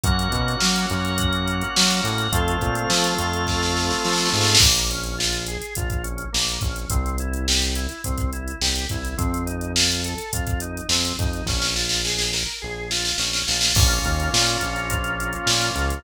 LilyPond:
<<
  \new Staff \with { instrumentName = "Drawbar Organ" } { \time 4/4 \key bes \minor \tempo 4 = 105 <bes des' ges'>1 | <a c' f'>1 | bes8 des'8 f'8 aes'8 f'8 des'8 bes8 des'8 | c'8 e'8 g'8 e'8 c'8 e'8 g'8 e'8 |
c'8 ees'8 f'8 a'8 f'8 ees'8 c'8 ees'8 | des'8 f'8 aes'8 bes'8 aes'8 f'8 des'8 f'8 | <bes des' f'>1 | }
  \new Staff \with { instrumentName = "Synth Bass 1" } { \clef bass \time 4/4 \key bes \minor ges,8 b,8 ges8 ges,4. ges8 a,8 | f,8 bes,8 f8 f,4. f8 aes,8 | bes,,2 bes,,4 bes,,8 bes,,8 | c,2 c,4 c,8 c,8 |
f,2 f,4 f,8 f,8 | bes,,2 bes,,4 bes,,8 bes,,8 | bes,,8 ees,8 bes,8 bes,,4. bes,8 des,8 | }
  \new Staff \with { instrumentName = "Drawbar Organ" } { \time 4/4 \key bes \minor <bes' des'' ges''>2 <ges' bes' ges''>2 | <a' c'' f''>2 <f' a' f''>2 | r1 | r1 |
r1 | r1 | <bes des' f'>2 <f bes f'>2 | }
  \new DrumStaff \with { instrumentName = "Drums" } \drummode { \time 4/4 <hh bd>16 hh16 <hh bd>16 hh16 sn16 hh16 hh16 hh16 <hh bd>16 hh16 hh16 hh16 sn16 hh16 hh16 hh16 | <hh bd>16 hh16 <hh bd>16 hh16 sn16 hh16 hh16 hh16 <bd sn>16 sn16 sn16 sn16 sn32 sn32 sn32 sn32 sn32 sn32 sn32 sn32 | <cymc bd>16 hh16 hh16 hh16 sn16 hh16 hh16 hh16 <hh bd>16 <hh bd>16 hh16 hh16 sn16 hh16 <hh bd>16 hh16 | <hh bd>16 hh16 hh16 hh16 sn16 hh16 hh16 hh16 <hh bd>16 <hh bd>16 hh16 hh16 sn16 hh16 <hh bd>16 hh16 |
<hh bd>16 hh16 hh16 hh16 sn16 hh16 hh16 hh16 <hh bd>16 <hh bd>16 hh16 hh16 sn16 hh16 <hh bd>16 hh16 | <bd sn>16 sn16 sn16 sn16 sn16 sn16 sn8 r8 sn16 sn16 sn16 sn16 sn16 sn16 | <cymc bd>16 hh16 <hh bd>16 hh16 sn16 hh16 hh16 hh16 <hh bd>16 hh16 hh16 hh16 sn16 hh16 hh16 hh16 | }
>>